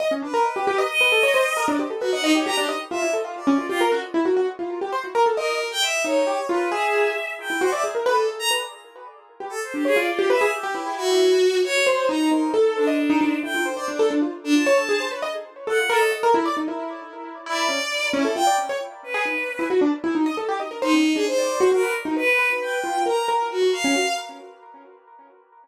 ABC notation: X:1
M:9/8
L:1/16
Q:3/8=89
K:none
V:1 name="Acoustic Grand Piano"
^d ^C =D ^A z G G ^d z B =A ^c =c z ^A =D G =A | B ^d d G G =D ^d z F E A F z ^C F G ^A ^F | z E ^F F z =F2 G c ^F ^A =A ^d2 z4 | ^D2 G z F2 ^G4 z3 E ^F =d G ^A |
B A A z B z7 G z2 D ^c F | d G B ^G z =G E6 z4 c2 | ^D2 D2 A3 ^d z D D z E F c c =D A | D F z2 F ^c A ^G =c B ^d z3 A F ^A d |
^d ^A E =d ^D E7 E2 ^C z3 | ^C A F d z ^c z3 ^G ^D z2 E ^F =D z E | ^D ^d A G d ^A c ^C z =D z =d2 ^F F B z ^D | B2 B4 F2 ^A2 A2 z ^F z ^C F z |]
V:2 name="Violin"
z2 B6 ^d7 z3 | ^F ^f ^D ^c ^a G z2 e2 z2 =d3 =F z2 | z12 ^A3 g e2 | ^c4 B2 e6 g2 =c e z2 |
A2 z ^a z9 =A c G ^G d | F2 e2 G4 ^F6 ^c2 c2 | ^a2 ^A2 z2 D6 g2 c d D2 | z3 D a5 z5 ^f2 A2 |
z12 d6 | E2 g2 z4 B6 z4 | z6 ^D3 ^G c4 ^A2 z2 | B3 z g4 ^a2 z2 ^F2 =f4 |]